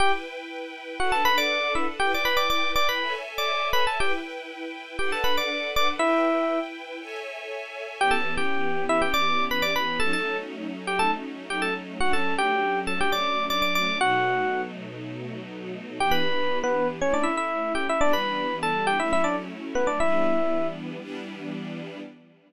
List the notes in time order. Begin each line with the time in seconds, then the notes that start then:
0.00 E4 G4 B4 G5
1.00 D4 F#4 A4 B4 F#5
1.12 A4 A5
1.25 B4 B5
1.38 D5 D6
1.75 E4 E5
2.00 E4 G4 B4 G5
2.14 D5 D6
2.25 B4 B5
2.37 D5 D6
2.50 D5 D6
2.76 D5 D6
2.89 B4 B5
3.00 A4 C#5 E5 G#5
3.38 D5 D6
3.73 B4 B5
3.87 A4 A5
4.00 E4 G4 B4 G5
4.99 D4 G4 A4 B4 F#5 G5
5.12 A4 A5
5.24 B4 B5
5.37 D5 D6
5.76 D5 D6
5.99 E4 B4 E5 G5
7.00 A4 C#5 E5 G#5
8.00 E3 B3 C#4 G4 G5
8.11 A4 A5
8.37 G4 G5
8.89 E4 E5
9.02 G4 G5
9.14 D5 D6
9.51 B4 B5
9.62 D5 D6
9.76 B4 B5
10.00 F#3 A3 C#4 D#4 A4 A5
10.13 A4 A5
10.87 G4 G5
10.99 A4 A5
11.50 G4 G5
11.62 A4 A5
12.00 F#3 A3 C#4 D4 F#4 F#5
12.13 A4 A5
12.38 G4 G5
12.87 A4 A5
13.01 G4 G5
13.12 D5 D6
13.50 D5 D6
13.62 D5 D6
13.75 D5 D6
14.00 B2 F#3 A3 D#4 F#4 F#5
16.00 E3 B3 D4 G4 G5
16.11 B4 B5
16.64 B3 B4
17.00 A3 C#4 E4 C#5
17.14 D4 D5
17.23 E4 E5
17.37 E4 E5
17.75 G4 G5
17.89 E4 E5
18.00 E3 G3 B3 D4 D5
18.13 B4 B5
18.63 A4 A5
18.87 G4 G5
19.00 F#3 A3 C#4 E4 E5
19.13 E4 E5
19.24 D4 D5
19.75 B3 B4
19.87 D4 D5
20.00 E3 G3 B3 D4 E4 E5
21.00 E3 G3 B3 D4